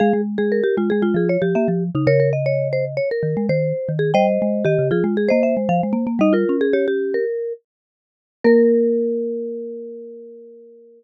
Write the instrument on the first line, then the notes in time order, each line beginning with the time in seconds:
marimba
0.00 G#3 G#4 F5
0.13 G#3
0.38 G#3 G#4
0.52 A#4
0.64 G4
0.77 G#3 F4
0.90 G#3 G#4
1.02 G#3 F4
1.14 F3 G#4
1.29 C#5
1.42 F3 G4
1.55 A#3 E5
1.68 F3
1.95 C#3 D#4
2.07 C#3 A#4 C#5
2.20 A#4
2.33 D#5
2.46 C#5
2.73 C5
2.97 C#5
3.11 A#4
3.23 D#3
3.37 G#3
3.49 D#3 C5
3.89 D#3
3.99 G#4
4.14 G3 C5 D#5 G5
4.42 G#3
4.65 D#3 G4 D#5
4.79 C#3
4.91 F3 F4 G#4
5.04 G#3
5.17 G#4
5.29 A#3 C5 D#5
5.43 E5
5.57 G#3
5.69 F3 F5
5.83 G#3
5.93 A#3
6.07 A#3
6.19 G3 D#4 D#5
6.33 F4 A#4
6.49 C#4
6.61 G#4
6.73 G4 C#5
6.88 G4
7.14 A#4
8.44 A#3 A#4